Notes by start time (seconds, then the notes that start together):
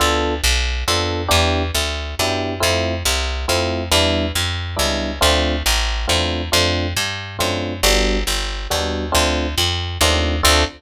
0.00 D2 B3 D4 F4 A4
0.44 B1
0.88 F2 B3 D4 F4 A4
1.28 E2 B3 D4 E4 G4
1.75 D2
2.19 F#2 B3 D4 E4 G4
2.60 F2 A3 C4 E4 F4
3.05 C2
3.48 F2 A3 C4 E4 F4
3.91 E2 G3 B3 D4 E4
4.35 F2
4.76 C#2 G3 B3 D4 E4
5.21 D2 A3 C4 D4 F4
5.66 A1
6.08 E2 A3 C4 D4 F4
6.52 F2 A3 C4 D4 F4
6.97 G2
7.39 F#2 A3 C4 D4 F4
7.83 G1 G3 B3 D4 F#4
8.27 G1
8.70 D#2 G3 B3 D4 F#4
9.12 D2 A3 C4 D4 F4
9.58 F2
10.01 D#2 A3 C4 D4 F4
10.43 D2 C4 D4 F4 A4